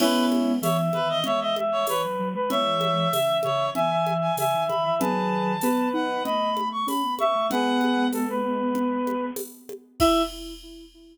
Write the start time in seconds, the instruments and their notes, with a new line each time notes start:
0.00 ocarina G#3 B3, brass section C#4 E4, clarinet B4, crash, low conga
0.32 high conga
0.62 ocarina E3, clarinet C#5, brass section E5, tambourine, high conga
0.93 ocarina D#3, clarinet B4, high conga
1.09 clarinet D#5
1.24 ocarina G#3, clarinet C#5, brass section E5, low conga
1.40 clarinet D#5, brass section E5
1.56 brass section E5, high conga
1.72 clarinet C#5
1.87 ocarina E3, brass section B4, clarinet C#5, tambourine, high conga
2.04 ocarina F#3
2.19 ocarina F#3
2.34 ocarina G#3, brass section B4
2.50 ocarina E3 G#3, brass section C#5 E5, clarinet E5, low conga
2.81 high conga
3.12 ocarina C#3, brass section E5, tambourine, high conga
3.43 ocarina C#3, clarinet C#5, high conga
3.75 ocarina E3, brass section E5, clarinet G#5, low conga
3.91 brass section E5
4.06 brass section E5, high conga
4.21 clarinet G#5
4.37 ocarina C#3, brass section E5, clarinet G#5, tambourine, high conga
4.54 ocarina D#3
4.68 ocarina D#3, clarinet B5, high conga
4.84 ocarina E3, brass section E5
4.99 ocarina D#3 F#3, brass section G#4 B4, clarinet A5, low conga
5.61 ocarina B3, brass section B4, tambourine, high conga
5.93 ocarina D#4, clarinet F#5
6.24 ocarina A3, brass section D#5, clarinet B5, low conga
6.57 high conga
6.72 clarinet C#6
6.87 ocarina C#4, clarinet B5, tambourine, high conga
7.04 ocarina B3
7.18 ocarina B3, brass section E5, clarinet C#6, high conga
7.35 ocarina A3
7.50 ocarina G#3 B3, brass section G#4 B4, clarinet F#5, low conga
7.81 high conga
8.13 brass section A4, tambourine, high conga
8.30 brass section B4
8.75 low conga
9.07 high conga
9.36 tambourine, high conga
9.69 high conga
10.00 ocarina E4, brass section E5, clarinet E5, kick, crash